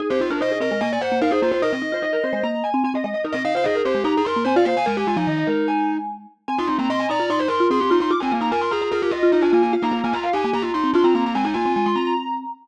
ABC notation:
X:1
M:4/4
L:1/16
Q:1/4=148
K:Ablyd
V:1 name="Marimba"
A c2 B c A B B a2 _g2 f c c c | B e2 c e B c c b2 a2 a e e e | B e2 c e B c c b2 c'2 a f c a | a a a2 e e B2 a6 z2 |
a c'2 b c' a b b c'2 c'2 c' c' c' c' | d' a2 b a c' b b B2 e2 e a a a | f b2 a b f a a b2 c'2 c' b b b | a a a2 a c' b b5 z4 |]
V:2 name="Marimba"
z G F D e2 e2 e d c2 B A F F | e12 z4 | z e f f A2 G2 G A B2 c d f f | B G F E9 z4 |
z F E C e2 d2 d c B2 A G E E | z C B, B, B2 A2 A G F2 E D B, B, | z B, B, B, F2 G2 G F E2 D C B, B, | C E F6 z8 |]
V:3 name="Marimba"
E C E F E2 C A, B,2 z B, E E B, z | E C E F E2 C A, B,2 z C C C A, z | E C E F E2 C A, E2 z B, C F B, z | A,2 A, F, E,2 A,8 z2 |
C E C B, C2 E F E2 z F C C F z | F F F E F2 F F F2 z F F F F z | F E F F F2 E B, B,2 z C F F C z | A,2 B, C A, A, C6 z4 |]